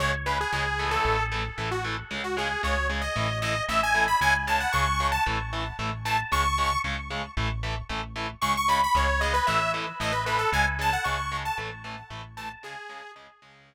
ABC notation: X:1
M:4/4
L:1/16
Q:1/4=114
K:C#m
V:1 name="Lead 2 (sawtooth)"
c z B G G3 A3 z3 F z2 | z F G2 c2 z d3 d2 e g2 b | g z a f c'3 a z6 a z | c'4 z12 |
c' c' b b c2 d B e2 z2 d B B A | g z a f c'3 a z6 a z | G4 z12 |]
V:2 name="Overdriven Guitar"
[C,G,]2 [C,G,]2 [C,G,]2 [E,A,]4 [E,A,]2 [E,A,]2 [E,A,]2 | [C,G,]2 [C,G,]2 [C,G,]2 [C,G,]2 [E,A,]2 [E,A,]2 [E,A,]2 [E,A,]2 | [C,G,]2 [C,G,]2 [C,G,]2 [C,G,]2 [E,A,]2 [E,A,]2 [E,A,]2 [E,A,]2 | [C,G,]2 [C,G,]2 [C,G,]2 [C,G,]2 [E,A,]2 [E,A,]2 [E,A,]2 [E,A,]2 |
[C,G,]2 [C,G,]2 [C,G,]2 [C,G,]2 [E,A,]2 [E,A,]2 [E,A,]2 [E,A,]2 | [C,G,]2 [C,G,]2 [C,G,]2 [C,G,]2 [E,A,]2 [E,A,]2 [E,A,]2 [E,A,]2 | [C,G,]2 [C,G,]2 [C,G,]2 [C,G,]4 z6 |]
V:3 name="Synth Bass 1" clef=bass
C,,4 C,,4 A,,,4 A,,,4 | C,,4 C,,4 A,,,4 A,,,4 | C,,4 C,,4 A,,,4 A,,,4 | C,,4 C,,4 A,,,4 A,,,4 |
C,,4 C,,4 A,,,4 A,,,4 | C,,4 C,,4 A,,,4 A,,,4 | z16 |]